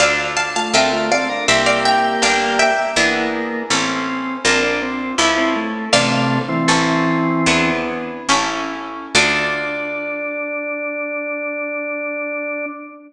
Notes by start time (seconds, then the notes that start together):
0.00 D2 D4 F4 A4 D5 F5
0.37 F5 A5
0.56 A3 F4 F5 A5
0.73 D2 C4 D4 F4 A4 A#4 E5 G5
0.93 A3 F4
1.11 C4 A4 D5 F5
1.29 D4 A#4
1.48 C2 A#3 C4 E4 G4 C5 E5
1.66 D5 F5
1.85 E5 G5
2.22 G1 A#3 D4 G4 D5 F5
2.59 E5 G5
2.96 E2 A#3 B3 D4 E4 G#4
3.70 A1 C4 C#4 E4 A4
4.44 A#1 C4 D4 F4 A#4
4.63 D4
4.82 C4
5.18 C#2 C#4 E4 A4
5.37 C4
5.56 A3
5.93 A1 C3 A3 D4 F4 A4 D5 F5
6.49 E3 C4
6.68 A1 C#4 E4 A4
7.46 E2 B3 D4 E4 G#4
8.29 A1 C#4 E4 A4
9.15 D2 D4 F4 A4 D5